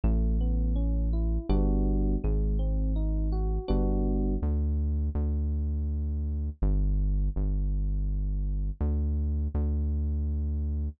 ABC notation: X:1
M:3/4
L:1/8
Q:1/4=82
K:Amix
V:1 name="Electric Piano 1"
A, B, C E [G,B,DF]2 | _A, =C _E _G [=G,B,DF]2 | [K:Dmix] z6 | z6 |
z6 |]
V:2 name="Synth Bass 1" clef=bass
A,,,4 G,,,2 | _A,,,4 G,,,2 | [K:Dmix] D,,2 D,,4 | G,,,2 G,,,4 |
D,,2 D,,4 |]